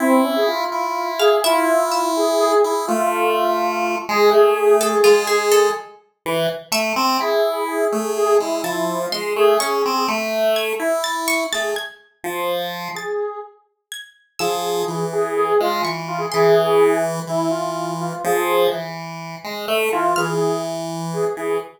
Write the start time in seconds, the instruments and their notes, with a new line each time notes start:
0.00 lead 1 (square) C4 E4
0.24 lead 1 (square) C#4
0.36 lead 1 (square) G#4
0.47 lead 1 (square) F4
0.72 lead 1 (square) E4
1.19 lead 1 (square) G#4, orchestral harp F5
1.44 lead 1 (square) E4 F4, orchestral harp E5
1.92 orchestral harp E5
2.17 lead 1 (square) G#4
2.40 lead 1 (square) G#4
2.64 lead 1 (square) E4 G#4
2.87 lead 1 (square) A3 F4
4.09 lead 1 (square) G#3 G#4
4.31 lead 1 (square) A3 G#4
4.81 lead 1 (square) G#4, orchestral harp A4
5.04 lead 1 (square) G#3, orchestral harp F4
5.27 orchestral harp G#4, lead 1 (square) G#4
5.51 orchestral harp A4
6.26 lead 1 (square) E3
6.71 lead 1 (square) A3, orchestral harp E5
6.96 lead 1 (square) C4
7.18 lead 1 (square) E4 G#4
7.68 lead 1 (square) G#4
7.92 lead 1 (square) A3
8.16 lead 1 (square) G#4
8.26 lead 1 (square) G#4
8.40 lead 1 (square) G#3 E4
8.63 lead 1 (square) F3 E4, orchestral harp A5
9.01 lead 1 (square) F4
9.12 lead 1 (square) G#3, orchestral harp C6
9.36 lead 1 (square) A3 G#4
9.59 lead 1 (square) C#4 G#4, orchestral harp C#6
9.86 lead 1 (square) C4
10.08 lead 1 (square) A3
10.56 orchestral harp G#6
10.79 lead 1 (square) E4
11.04 orchestral harp A6
11.28 orchestral harp C#6
11.52 lead 1 (square) A3 G#4, orchestral harp A6
11.76 orchestral harp G#6
12.24 lead 1 (square) F3
12.95 lead 1 (square) G#4, orchestral harp A6
13.92 orchestral harp G#6
14.39 lead 1 (square) F3 G#4, orchestral harp E6
14.88 lead 1 (square) E3
15.13 lead 1 (square) G#4
15.36 lead 1 (square) G#4
15.60 lead 1 (square) G#3 F4
15.83 lead 1 (square) E3, orchestral harp C#6
16.08 lead 1 (square) F4
16.18 lead 1 (square) G#4
16.32 lead 1 (square) E3 G#4, orchestral harp C6
17.27 lead 1 (square) E3 E4
17.50 lead 1 (square) F4
18.01 lead 1 (square) F4
18.24 lead 1 (square) F3 G#4
18.71 lead 1 (square) E3
19.44 lead 1 (square) G#3
19.68 lead 1 (square) A3
19.92 lead 1 (square) E3 F4
20.16 lead 1 (square) E3 G#4, orchestral harp F6
21.14 lead 1 (square) G#4
21.37 lead 1 (square) E3